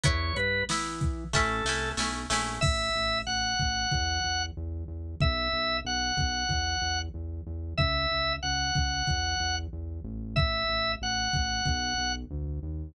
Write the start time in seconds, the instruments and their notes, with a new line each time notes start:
0.03 synth bass 1 E2, acoustic guitar (steel) B3 E4, drawbar organ C#5, kick, closed hi-hat
0.36 synth bass 1 G2, drawbar organ B4, closed hi-hat
0.69 synth bass 1 E3, acoustic guitar (steel) B3 E4, snare
1.01 kick, closed hi-hat
1.33 synth bass 1 A1, acoustic guitar (steel) A3 C#4 E4, drawbar organ A4, kick, snare
1.65 synth bass 1 C2, acoustic guitar (steel) A3 C#4 E4, snare
1.97 synth bass 1 B1, acoustic guitar (steel) A3 C#4 E4, snare
2.30 synth bass 1 A#1, acoustic guitar (steel) A3 C#4 E4, snare
2.61 synth bass 1 A1, drawbar organ E5, kick, crash
2.95 synth bass 1 A1
3.27 synth bass 1 A1, drawbar organ F#5
3.59 synth bass 1 A1, kick
3.92 synth bass 1 E2, kick
4.24 synth bass 1 E2
4.57 synth bass 1 E2
4.88 synth bass 1 E2
5.21 synth bass 1 B1, drawbar organ E5, kick
5.53 synth bass 1 B1
5.85 synth bass 1 B1, drawbar organ F#5
6.17 synth bass 1 B1, kick
6.49 synth bass 1 E2, kick
6.82 synth bass 1 E2
7.14 synth bass 1 E2
7.47 synth bass 1 E2
7.78 synth bass 1 C#2, drawbar organ E5, kick
8.12 synth bass 1 C#2
8.43 synth bass 1 C#2, drawbar organ F#5
8.75 synth bass 1 C#2, kick
9.07 synth bass 1 E2, kick
9.40 synth bass 1 E2
9.73 synth bass 1 E2
10.04 synth bass 1 A1
10.36 drawbar organ E5, kick
10.69 synth bass 1 A1
11.01 synth bass 1 A1, drawbar organ F#5
11.33 synth bass 1 A1, kick
11.66 synth bass 1 B1, kick
11.98 synth bass 1 B1
12.31 synth bass 1 D2
12.63 synth bass 1 D#2